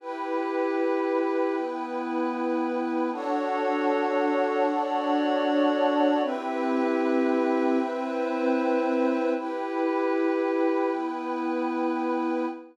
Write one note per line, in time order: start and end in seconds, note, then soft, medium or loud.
0.00 1.55 E4 medium
0.00 3.10 E4 medium
0.00 1.55 G4 medium
0.00 1.55 B4 medium
0.00 3.10 B4 medium
0.00 3.10 G5 medium
1.56 3.11 B3 medium
1.56 3.11 E4 medium
1.56 3.11 B4 medium
3.12 4.66 D4 medium
3.12 6.21 D4 loud
3.12 4.66 F#4 medium
3.12 4.66 A4 medium
3.12 6.21 A4 medium
3.12 4.66 C#5 medium
3.12 6.21 C#5 medium
3.12 6.21 F#5 medium
4.68 6.22 D4 medium
4.68 6.22 F#4 medium
4.68 6.22 C#5 medium
4.68 6.22 D5 medium
6.23 9.32 C4 medium
6.23 7.78 C4 medium
6.23 7.78 E4 medium
6.23 7.78 G4 medium
6.23 9.32 B4 medium
6.23 7.78 B4 medium
6.23 9.32 E5 medium
6.23 9.32 G5 loud
7.79 9.34 C4 medium
7.79 9.34 E4 medium
7.79 9.34 B4 medium
7.79 9.34 C5 medium
9.35 10.90 E4 medium
9.35 12.45 E4 medium
9.35 10.90 G4 medium
9.35 10.90 B4 medium
9.35 12.45 B4 medium
9.35 12.45 G5 medium
10.91 12.46 B3 medium
10.91 12.46 E4 medium
10.91 12.46 B4 medium